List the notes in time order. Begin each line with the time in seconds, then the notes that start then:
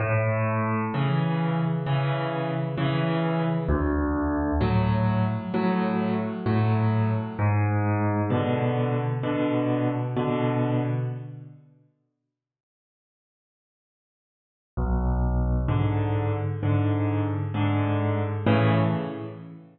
0.00 A2
0.94 C#3 E3
1.86 C#3 E3
2.78 C#3 E3
3.68 D2
4.61 A2 F#3
5.54 A2 F#3
6.46 A2 F#3
7.39 G#2
8.30 B2 D3
9.23 B2 D3
10.17 B2 D3
14.77 B1
15.68 G#2 D3
16.63 G#2 D3
17.54 G#2 D3
18.47 A2 C#3 E3